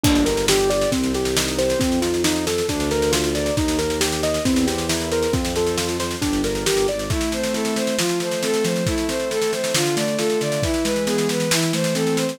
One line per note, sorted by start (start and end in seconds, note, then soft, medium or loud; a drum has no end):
0.03 0.86 G1 medium
0.03 0.24 A#3 medium
0.03 0.24 D4 medium
0.03 kick loud
0.03 snare medium
0.03 crash loud
0.15 snare medium
0.25 0.46 G4 medium
0.25 0.46 A#4 medium
0.25 snare medium
0.37 snare medium
0.48 0.68 D4 medium
0.48 0.69 G4 medium
0.48 snare loud
0.59 snare medium
0.70 0.90 G4 medium
0.70 0.90 D5 medium
0.70 snare medium
0.81 snare medium
0.92 1.74 C2 medium
0.92 1.12 C4 medium
0.92 kick medium
0.92 snare medium
1.03 snare medium
1.14 1.34 G4 medium
1.14 1.36 G4 medium
1.14 snare medium
1.25 snare medium
1.37 1.56 D#4 medium
1.37 1.57 D#4 medium
1.37 snare loud
1.48 snare medium
1.59 1.79 G4 medium
1.59 1.79 C5 medium
1.59 snare medium
1.70 snare medium
1.80 2.61 F2 medium
1.80 2.00 C4 medium
1.80 kick loud
1.80 snare medium
1.92 snare medium
2.02 2.23 D#4 medium
2.02 2.22 F4 medium
2.02 snare medium
2.14 snare medium
2.24 2.45 D#4 medium
2.24 2.45 F4 medium
2.24 snare loud
2.36 snare medium
2.47 2.67 A4 medium
2.47 2.67 A4 soft
2.47 snare loud
2.58 snare medium
2.69 3.50 D2 loud
2.69 2.89 D4 medium
2.69 2.90 D4 medium
2.69 kick medium
2.69 snare medium
2.80 snare medium
2.91 3.11 A#4 medium
2.91 snare medium
3.02 snare medium
3.12 3.32 F4 medium
3.12 3.33 F4 medium
3.12 snare loud
3.24 snare medium
3.35 3.55 A#4 medium
3.35 3.55 D5 medium
3.35 snare medium
3.46 snare medium
3.57 4.39 D#2 medium
3.57 3.77 D#4 medium
3.57 3.78 D#4 medium
3.57 kick loud
3.57 snare medium
3.68 snare medium
3.79 3.99 A#4 medium
3.79 snare medium
3.90 snare medium
4.01 4.21 G4 medium
4.01 snare loud
4.12 snare medium
4.23 4.43 A#4 medium
4.23 4.44 D#5 medium
4.23 snare medium
4.34 snare medium
4.45 5.27 E2 medium
4.45 4.66 C4 medium
4.45 4.65 E4 medium
4.45 kick loud
4.45 snare medium
4.56 snare medium
4.67 4.87 G4 medium
4.67 4.87 C5 medium
4.67 snare medium
4.78 snare medium
4.89 5.09 E4 medium
4.89 5.09 A#4 medium
4.89 snare loud
5.00 snare medium
5.11 5.32 A#4 medium
5.11 5.31 C5 medium
5.11 snare medium
5.23 snare medium
5.33 6.15 F2 medium
5.33 5.53 C4 medium
5.33 5.53 F4 medium
5.33 kick loud
5.33 snare medium
5.45 snare medium
5.56 5.77 A4 medium
5.56 5.76 C5 medium
5.56 snare medium
5.67 snare medium
5.77 5.98 F4 medium
5.77 5.97 A4 medium
5.77 snare loud
5.89 snare medium
6.00 6.20 C5 medium
6.00 snare medium
6.11 snare medium
6.22 6.64 G1 medium
6.22 6.42 D4 medium
6.22 6.42 G4 medium
6.22 kick medium
6.22 snare medium
6.33 snare medium
6.44 6.65 A#4 medium
6.44 6.64 D5 medium
6.44 snare medium
6.55 snare medium
6.66 6.86 G1 medium
6.66 6.87 G4 medium
6.66 6.86 A#4 medium
6.66 snare loud
6.77 snare medium
6.88 7.08 G#1 medium
6.88 7.08 D5 medium
6.88 7.09 D5 medium
6.88 snare medium
6.99 snare medium
7.10 7.76 A3 loud
7.10 7.31 E4 medium
7.10 kick loud
7.10 snare medium
7.21 snare medium
7.32 7.95 C4 medium
7.32 7.53 C5 medium
7.32 snare medium
7.43 snare medium
7.53 7.96 E4 medium
7.53 7.74 A4 medium
7.53 snare medium
7.65 snare medium
7.76 7.97 A3 medium
7.76 7.96 C5 medium
7.76 snare medium
7.87 snare medium
7.98 8.64 F3 loud
7.98 8.19 F4 medium
7.98 snare loud
8.09 snare medium
8.20 8.83 A3 medium
8.20 8.42 C5 soft
8.20 snare medium
8.31 snare medium
8.42 8.84 C4 medium
8.42 8.63 A4 medium
8.42 snare medium
8.54 snare medium
8.64 8.85 F3 medium
8.64 8.85 C5 medium
8.64 snare medium
8.76 snare medium
8.86 9.52 A3 loud
8.86 9.06 E4 medium
8.86 kick loud
8.86 snare medium
8.98 snare medium
9.08 9.71 C4 medium
9.08 9.29 C5 medium
9.08 snare medium
9.19 snare medium
9.31 9.72 E4 medium
9.31 9.51 A4 medium
9.31 snare medium
9.42 snare medium
9.52 9.74 A3 medium
9.52 9.73 C5 medium
9.52 snare medium
9.64 snare medium
9.74 10.40 D3 loud
9.74 9.95 F4 medium
9.74 snare loud
9.86 snare medium
9.96 10.60 A3 medium
9.96 10.16 D5 medium
9.96 snare loud
10.08 snare medium
10.18 10.61 F4 medium
10.18 10.39 A4 medium
10.18 snare medium
10.30 snare medium
10.41 10.62 D3 medium
10.41 10.61 D5 medium
10.41 snare medium
10.52 snare medium
10.63 11.29 E3 loud
10.63 10.84 E4 medium
10.63 kick loud
10.63 snare medium
10.74 snare medium
10.84 11.48 G#3 medium
10.84 11.05 B4 medium
10.84 snare medium
10.96 snare medium
11.07 11.49 B3 medium
11.07 11.27 G#4 medium
11.07 snare medium
11.18 snare medium
11.29 11.50 E3 medium
11.29 11.50 B4 medium
11.29 snare medium
11.40 snare medium
11.51 12.17 E3 medium
11.51 11.72 E4 medium
11.51 snare loud
11.62 snare medium
11.73 12.36 A3 medium
11.73 11.94 C5 medium
11.73 snare medium
11.84 snare medium
11.95 12.37 C4 medium
11.95 12.15 A4 medium
11.95 snare medium
12.07 snare medium
12.17 12.38 E3 medium
12.17 12.37 C5 soft
12.17 snare medium
12.29 snare medium